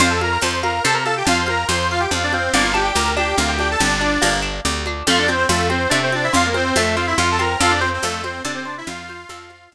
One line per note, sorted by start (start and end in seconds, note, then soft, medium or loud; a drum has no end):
0.00 0.38 F2 medium
0.00 0.09 F4 medium
0.00 0.18 C5 loud
0.00 0.09 F5 medium
0.00 cowbell loud
0.00 low conga loud
0.10 0.20 A4 medium
0.10 0.20 A5 medium
0.21 0.31 A#4 medium
0.21 0.40 F5 medium
0.21 0.31 A#5 medium
0.21 high conga medium
0.32 0.42 A#4 medium
0.32 0.42 A#5 medium
0.42 0.80 F2 medium
0.42 0.59 C5 medium
0.42 0.62 A5 medium
0.42 0.59 C6 medium
0.42 tambourine medium
0.42 cowbell medium
0.42 high conga medium
0.63 0.83 A#4 medium
0.63 0.82 F5 medium
0.63 0.83 A#5 medium
0.63 high conga medium
0.84 1.23 C3 medium
0.84 0.94 A4 medium
0.84 1.03 C5 medium
0.84 0.94 A5 medium
0.84 cowbell medium
0.84 low conga medium
0.94 1.04 A#4 medium
0.94 1.04 A#5 medium
1.05 1.15 A4 medium
1.05 1.25 F5 medium
1.05 1.15 A5 medium
1.05 high conga medium
1.17 1.27 G4 medium
1.17 1.27 G5 medium
1.25 1.65 F2 medium
1.25 1.38 F4 medium
1.25 1.38 F5 medium
1.25 1.44 A5 medium
1.25 cowbell loud
1.25 low conga loud
1.39 1.49 C5 medium
1.39 1.49 C6 medium
1.46 1.67 A#4 medium
1.46 1.65 F5 medium
1.46 1.67 A#5 medium
1.46 high conga medium
1.68 2.07 F2 medium
1.68 1.88 C5 medium
1.68 1.88 C6 medium
1.68 tambourine medium
1.68 cowbell medium
1.68 high conga medium
1.91 2.01 F4 medium
1.91 2.01 F5 medium
1.91 2.10 F5 medium
2.00 2.10 G4 medium
2.00 2.10 G5 medium
2.11 2.49 F2 medium
2.11 2.23 F4 medium
2.11 2.23 F5 medium
2.11 2.30 A5 medium
2.11 cowbell medium
2.11 low conga medium
2.23 2.33 D4 medium
2.23 2.33 D5 medium
2.32 2.52 C4 medium
2.32 2.52 C5 medium
2.32 2.52 F5 medium
2.32 high conga medium
2.53 2.92 G1 medium
2.53 2.73 A#3 loud
2.53 2.63 D4 medium
2.53 2.63 D5 medium
2.53 cowbell medium
2.53 low conga loud
2.63 2.73 F4 medium
2.63 2.73 F5 medium
2.74 2.93 D4 medium
2.74 2.83 G4 medium
2.74 2.83 G5 medium
2.74 high conga medium
2.84 2.94 G4 medium
2.84 2.94 G5 medium
2.95 3.34 D2 medium
2.95 3.14 G4 medium
2.95 3.14 A#4 medium
2.95 3.14 A#5 medium
2.95 tambourine medium
2.95 cowbell medium
2.95 high conga medium
3.17 3.36 D4 medium
3.17 3.37 G4 medium
3.17 3.37 G5 medium
3.17 high conga medium
3.37 3.76 D2 medium
3.37 3.56 A#3 medium
3.37 3.49 F4 medium
3.37 3.49 F5 medium
3.37 cowbell medium
3.37 low conga medium
3.48 3.58 G4 medium
3.48 3.58 G5 medium
3.59 3.79 D4 medium
3.59 3.69 G4 medium
3.59 3.69 G5 medium
3.59 high conga medium
3.71 3.81 A4 medium
3.71 3.81 A5 medium
3.80 4.18 G1 medium
3.80 4.33 D4 medium
3.80 3.99 G4 medium
3.80 4.33 D5 medium
3.80 cowbell loud
3.80 low conga medium
4.01 4.20 D4 medium
4.01 high conga medium
4.22 4.61 G1 medium
4.22 4.41 A#3 medium
4.22 tambourine medium
4.22 cowbell medium
4.22 high conga medium
4.42 4.61 D4 medium
4.65 5.03 D2 medium
4.65 4.84 G4 medium
4.65 cowbell medium
4.65 low conga medium
4.86 5.06 D4 medium
4.86 high conga medium
5.07 5.45 F2 medium
5.07 5.27 A3 loud
5.07 5.19 F4 medium
5.07 5.19 F5 medium
5.07 cowbell loud
5.07 low conga loud
5.19 5.29 D4 medium
5.19 5.29 D5 medium
5.28 5.37 C4 medium
5.28 5.48 C4 medium
5.28 5.37 C5 medium
5.28 high conga medium
5.37 5.47 C4 medium
5.37 5.47 C5 medium
5.49 5.87 F2 medium
5.49 5.68 A3 medium
5.49 5.68 F4 medium
5.49 5.68 A4 medium
5.49 tambourine medium
5.49 cowbell loud
5.49 high conga medium
5.70 5.89 C4 medium
5.70 5.91 C4 medium
5.70 5.91 C5 medium
5.70 high conga medium
5.89 6.29 C3 medium
5.89 6.11 A3 medium
5.89 5.99 D4 medium
5.89 5.99 D5 medium
5.89 cowbell medium
5.89 low conga medium
6.03 6.13 C4 medium
6.03 6.13 C5 medium
6.12 6.32 C4 medium
6.12 6.25 D4 medium
6.12 6.25 D5 medium
6.12 high conga medium
6.24 6.34 E4 medium
6.24 6.34 E5 medium
6.33 6.72 F2 medium
6.33 6.52 F4 medium
6.33 6.45 F4 medium
6.33 6.45 F5 medium
6.33 cowbell loud
6.33 low conga loud
6.46 6.56 A#3 medium
6.46 6.56 A#4 medium
6.54 6.73 C4 medium
6.54 6.76 C4 medium
6.54 6.76 C5 medium
6.54 high conga medium
6.75 7.14 F2 medium
6.75 6.96 A3 medium
6.75 6.96 A4 medium
6.75 tambourine medium
6.75 cowbell medium
6.75 high conga medium
6.96 7.16 C4 medium
6.96 7.06 F4 medium
6.96 7.06 F5 medium
7.07 7.17 E4 medium
7.07 7.17 E5 medium
7.18 7.56 F2 medium
7.18 7.37 F4 medium
7.18 7.28 F4 medium
7.18 7.28 F5 medium
7.18 cowbell medium
7.18 high conga medium
7.31 7.41 A4 medium
7.31 7.41 A5 medium
7.39 7.58 C4 medium
7.39 7.61 A#4 medium
7.39 7.61 A#5 medium
7.39 high conga medium
7.60 7.99 F2 medium
7.60 7.71 F4 medium
7.60 7.80 A4 medium
7.60 7.71 F5 medium
7.60 cowbell loud
7.60 low conga loud
7.70 7.80 D4 medium
7.70 7.80 D5 medium
7.79 7.90 C4 medium
7.79 7.90 C5 medium
7.79 8.00 C5 medium
7.79 high conga medium
7.93 8.03 C4 medium
7.93 8.03 C5 medium
8.03 8.41 F2 medium
8.03 8.22 A3 medium
8.03 8.22 A4 medium
8.03 8.22 F5 medium
8.03 tambourine medium
8.03 cowbell medium
8.03 high conga medium
8.23 8.43 C4 medium
8.23 8.43 C5 medium
8.23 high conga medium
8.44 8.83 C3 medium
8.44 8.54 D4 medium
8.44 8.64 A4 medium
8.44 8.54 D5 medium
8.44 cowbell medium
8.44 low conga medium
8.55 8.65 C4 medium
8.55 8.65 C5 medium
8.65 8.76 D4 medium
8.65 8.84 C5 medium
8.65 8.76 D5 medium
8.78 8.88 E4 medium
8.78 8.88 E5 medium
8.87 9.25 F2 medium
8.87 9.69 F4 medium
8.87 9.06 F5 medium
8.87 9.69 F5 medium
8.87 cowbell loud
8.87 low conga loud
9.09 9.28 C5 medium
9.09 high conga medium
9.29 9.68 F2 medium
9.29 9.48 A4 medium
9.29 tambourine medium
9.29 cowbell medium
9.29 high conga loud
9.50 9.69 C5 medium
9.50 high conga medium
9.71 9.75 F2 medium
9.71 9.75 F5 medium
9.71 cowbell medium
9.71 low conga medium